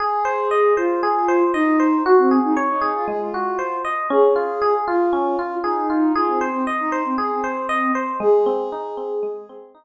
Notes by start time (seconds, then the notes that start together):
0.00 G#4
0.25 C5
0.51 D#5
0.77 F4 C5
1.03 G#4
1.28 C5
1.54 D#4 D#5
1.80 C5
2.05 F#4
2.18 C4
2.31 G#4
2.44 D#4
2.57 C#5
2.69 D#4
2.81 G#4
2.95 F4
3.08 G#3 G#4
3.20 F4
3.34 F#4
3.59 C5
3.85 D#5
4.10 C#4 G#4
4.36 F4
4.62 G#4
4.87 F4
5.13 C#4
5.39 F4
5.64 D#4 G#4
5.90 F4
6.15 F4 G#4
6.28 C4
6.41 C5
6.53 C4
6.67 D#5
6.80 D#4
6.92 C5
7.05 C4
7.18 G#4
7.31 C4
7.44 C5
7.69 D#5
7.95 C5
8.20 G#3 G#4
8.46 C4
8.72 D#4
8.97 C4
9.23 G#3
9.49 C4
9.75 D#4